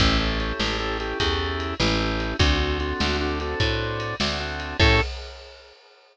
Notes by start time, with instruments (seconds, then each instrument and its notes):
0.00 electric bass (finger) A1, drawbar organ C#4 E4 G4 A4, kick, ride
0.20 drawbar organ C#4 E4 G4 A4
0.40 drawbar organ C#4 E4 G4 A4, ride
0.60 electric bass (finger) A1, snare
0.79 drawbar organ C#4 E4 G4 A4
1.00 drawbar organ C#4 E4 G4 A4, ride
1.19 electric bass (finger) E2, drawbar organ C#4 E4 G4 A4, kick, ride
1.60 ride
1.80 electric bass (finger) A1, drawbar organ C#4 E4 G4 A4, snare
1.99 drawbar organ C#4 E4 G4 A4
2.20 ride
2.39 electric bass (finger) D2, drawbar organ C4 D4 F#4 A4, kick, ride
2.60 drawbar organ C4 D4 F#4 A4
2.80 drawbar organ C4 D4 F#4 A4, ride
3.00 electric bass (finger) D2, snare
3.21 drawbar organ C4 D4 F#4 A4
3.40 drawbar organ C4 D4 F#4 A4, ride
3.60 electric bass (finger) A2, drawbar organ C4 D4 F#4 A4, kick, ride
4.00 ride
4.20 electric bass (finger) D2, drawbar organ C4 D4 F#4 A4, snare
4.40 drawbar organ C4 D4 F#4 A4
4.60 ride
4.79 electric bass (finger) A2, drawbar organ C#4 E4 G4 A4, kick, crash